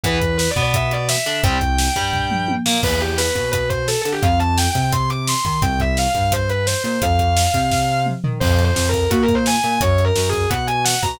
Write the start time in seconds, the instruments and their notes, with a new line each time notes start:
0.03 synth bass 1 E2, overdriven guitar E3 B3, distortion guitar B4, kick, closed hi-hat
0.21 kick, closed hi-hat
0.37 distortion guitar B4, snare
0.50 distortion guitar D5
0.56 synth bass 1 B2, overdriven guitar B3, kick, closed hi-hat
0.62 distortion guitar D5
0.74 distortion guitar E5, kick, closed hi-hat
0.91 distortion guitar D5, closed hi-hat
1.09 distortion guitar E5, snare
1.26 synth bass 1 D3, overdriven guitar D4, closed hi-hat
1.44 synth bass 1 C2, overdriven guitar G3 C4, distortion guitar G5, kick, closed hi-hat
1.61 kick, closed hi-hat
1.78 snare
1.96 synth bass 1 G2, overdriven guitar G3, kick, closed hi-hat
2.13 kick, floor tom
2.31 mid tom
2.48 high tom
2.66 synth bass 1 A#2, overdriven guitar A#3, snare
2.83 synth bass 1 E2, distortion guitar B4, kick, crash
3.01 distortion guitar G4, closed hi-hat
3.18 distortion guitar B4, snare
3.35 synth bass 1 B2, kick, closed hi-hat
3.51 distortion guitar B4, kick, closed hi-hat
3.69 distortion guitar C5, kick, closed hi-hat
3.88 distortion guitar A4, snare
4.01 synth bass 1 D3, distortion guitar A4, closed hi-hat
4.12 distortion guitar G4
4.22 synth bass 1 F2, distortion guitar F5, kick, closed hi-hat
4.39 distortion guitar A5, closed hi-hat
4.57 distortion guitar G5, snare
4.70 distortion guitar G5
4.75 synth bass 1 C3, kick, closed hi-hat
4.81 distortion guitar G5
4.92 distortion guitar C6, kick, closed hi-hat
5.10 distortion guitar D6, closed hi-hat
5.27 distortion guitar C6, snare
5.45 synth bass 1 D#3, distortion guitar C6, kick, closed hi-hat
5.62 synth bass 1 C2, distortion guitar G5, kick, closed hi-hat
5.80 distortion guitar E5, kick, closed hi-hat
5.97 distortion guitar F5, snare
6.09 distortion guitar F5
6.15 synth bass 1 G2, kick, closed hi-hat
6.20 distortion guitar F5
6.32 distortion guitar C5, kick, closed hi-hat
6.49 distortion guitar B4, closed hi-hat
6.66 distortion guitar C5, snare
6.83 synth bass 1 A#2, distortion guitar C5, closed hi-hat
7.02 synth bass 1 F2, distortion guitar F5, kick, closed hi-hat
7.19 kick, closed hi-hat
7.37 snare
7.54 synth bass 1 C3, kick, closed hi-hat
7.71 kick, snare
8.06 mid tom
8.24 synth bass 1 D#3, floor tom
8.40 synth bass 1 F2, distortion guitar C5, kick, crash
8.59 closed hi-hat
8.64 distortion guitar C5
8.76 synth bass 1 F2, snare
8.88 distortion guitar A#4
8.94 kick, closed hi-hat
9.10 synth bass 1 A#2, distortion guitar F#4, kick, closed hi-hat
9.22 distortion guitar A#4
9.28 kick, closed hi-hat
9.34 distortion guitar C5
9.46 distortion guitar G#5, snare
9.63 synth bass 1 A#2, closed hi-hat
9.81 synth bass 1 F#2, distortion guitar C#5, kick, closed hi-hat
9.98 closed hi-hat
10.05 distortion guitar A#4
10.16 synth bass 1 F#2, snare
10.29 distortion guitar G#4, closed hi-hat
10.33 kick
10.49 synth bass 1 B2, distortion guitar F#5, kick, closed hi-hat
10.67 distortion guitar G#5, closed hi-hat
10.84 distortion guitar F#5, snare
11.02 synth bass 1 B2, distortion guitar A#5, kick, closed hi-hat